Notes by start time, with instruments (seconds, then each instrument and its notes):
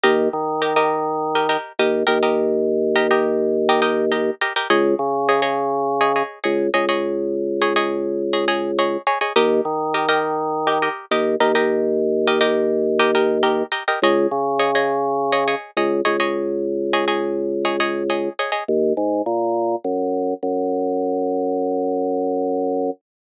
0.04 drawbar organ D#2, pizzicato strings G4 A#4 D#5
0.33 drawbar organ D#3
0.62 pizzicato strings G4 A#4 D#5
0.76 pizzicato strings G4 A#4 D#5
1.35 pizzicato strings G4 A#4 D#5
1.49 pizzicato strings G4 A#4 D#5
1.79 drawbar organ D#2, pizzicato strings G4 A#4 D#5
2.07 drawbar organ D#2, pizzicato strings G4 A#4 D#5
2.23 pizzicato strings G4 A#4 D#5
2.96 pizzicato strings G4 A#4 D#5
3.11 pizzicato strings G4 A#4 D#5
3.69 pizzicato strings G4 A#4 D#5
3.82 pizzicato strings G4 A#4 D#5
4.12 pizzicato strings G4 A#4 D#5
4.42 pizzicato strings G4 A#4 D#5
4.56 pizzicato strings G4 A#4 D#5
4.70 drawbar organ C#2, pizzicato strings G#4 C#5 D#5
4.99 drawbar organ C#3
5.29 pizzicato strings G#4 C#5 D#5
5.42 pizzicato strings G#4 C#5 D#5
6.01 pizzicato strings G#4 C#5 D#5
6.16 pizzicato strings G#4 C#5 D#5
6.44 drawbar organ C#2, pizzicato strings G#4 C#5 D#5
6.74 drawbar organ C#2, pizzicato strings G#4 C#5 D#5
6.89 pizzicato strings G#4 C#5 D#5
7.62 pizzicato strings G#4 C#5 D#5
7.76 pizzicato strings G#4 C#5 D#5
8.33 pizzicato strings G#4 C#5 D#5
8.48 pizzicato strings G#4 C#5 D#5
8.79 pizzicato strings G#4 C#5 D#5
9.07 pizzicato strings G#4 C#5 D#5
9.21 pizzicato strings G#4 C#5 D#5
9.36 drawbar organ D#2, pizzicato strings G4 A#4 D#5
9.65 drawbar organ D#3
9.94 pizzicato strings G4 A#4 D#5
10.09 pizzicato strings G4 A#4 D#5
10.67 pizzicato strings G4 A#4 D#5
10.82 pizzicato strings G4 A#4 D#5
11.11 drawbar organ D#2, pizzicato strings G4 A#4 D#5
11.40 drawbar organ D#2, pizzicato strings G4 A#4 D#5
11.55 pizzicato strings G4 A#4 D#5
12.28 pizzicato strings G4 A#4 D#5
12.41 pizzicato strings G4 A#4 D#5
12.99 pizzicato strings G4 A#4 D#5
13.15 pizzicato strings G4 A#4 D#5
13.43 pizzicato strings G4 A#4 D#5
13.72 pizzicato strings G4 A#4 D#5
13.88 pizzicato strings G4 A#4 D#5
14.02 drawbar organ C#2, pizzicato strings G#4 C#5 D#5
14.31 drawbar organ C#3
14.59 pizzicato strings G#4 C#5 D#5
14.75 pizzicato strings G#4 C#5 D#5
15.32 pizzicato strings G#4 C#5 D#5
15.48 pizzicato strings G#4 C#5 D#5
15.77 drawbar organ C#2, pizzicato strings G#4 C#5 D#5
16.05 drawbar organ C#2, pizzicato strings G#4 C#5 D#5
16.20 pizzicato strings G#4 C#5 D#5
16.93 pizzicato strings G#4 C#5 D#5
17.08 pizzicato strings G#4 C#5 D#5
17.65 pizzicato strings G#4 C#5 D#5
17.80 pizzicato strings G#4 C#5 D#5
18.10 pizzicato strings G#4 C#5 D#5
18.39 pizzicato strings G#4 C#5 D#5
18.52 pizzicato strings G#4 C#5 D#5
18.68 drawbar organ D#2
18.97 drawbar organ G#2
19.26 drawbar organ A#2
19.84 drawbar organ F#2
20.43 drawbar organ F#2